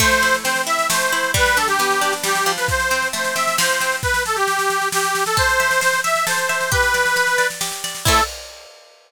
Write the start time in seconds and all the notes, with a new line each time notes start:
0.00 A3 C5, kick, snare, crash
0.11 snare
0.22 E4, snare
0.34 snare
0.43 C4 C5, snare
0.56 snare
0.66 E4 E5, snare
0.79 snare
0.90 A3 C5, snare
1.01 snare
1.12 E4, snare
1.23 snare
1.34 G3 B4, kick, snare
1.46 snare
1.57 D4 A4, snare
1.67 G4, snare
1.79 B3, snare
1.91 snare
2.01 D4, snare
2.13 snare
2.23 G3 G4, snare
2.35 snare
2.46 F3, snare
2.57 B4, snare
2.68 C5, kick, snare
2.80 snare
2.91 C4, snare
3.02 snare
3.13 A3 C5, snare
3.24 snare
3.35 C4 E5, snare
3.47 snare
3.58 F3 C5, snare
3.69 snare
3.81 C4, snare
3.92 snare
4.03 B4, kick, snare
4.14 snare
4.25 A4, snare
4.36 G4, snare
4.47 snare
4.59 snare
4.70 snare
4.82 snare
4.92 G4, snare
5.04 snare
5.15 snare
5.26 A4, snare
5.37 A4 C5, kick, snare
5.49 snare
5.60 E5, snare
5.71 snare
5.81 C5, snare
5.93 snare
6.04 E5, snare
6.16 snare
6.27 A4 C5, snare
6.38 snare
6.49 E5, snare
6.61 snare
6.71 G4 B4, kick, snare
6.83 snare
6.94 D5, snare
7.05 snare
7.16 B4, snare
7.27 snare
7.38 D5, snare
7.50 snare
7.61 G4, snare
7.72 snare
7.84 D5, snare
7.95 snare
8.05 A3 C4 E4 A4, kick, crash